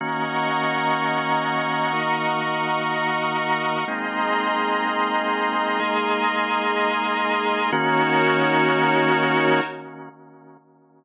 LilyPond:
<<
  \new Staff \with { instrumentName = "Drawbar Organ" } { \time 6/8 \key ees \dorian \tempo 4. = 62 <ees bes des' ges'>2. | <ees bes ees' ges'>2. | <aes bes c' ees'>2. | <aes bes ees' aes'>2. |
<ees bes des' ges'>2. | }
  \new Staff \with { instrumentName = "Pad 5 (bowed)" } { \time 6/8 \key ees \dorian <ees'' ges'' bes'' des'''>2.~ | <ees'' ges'' bes'' des'''>2. | <aes' ees'' bes'' c'''>2.~ | <aes' ees'' bes'' c'''>2. |
<ees' ges' bes' des''>2. | }
>>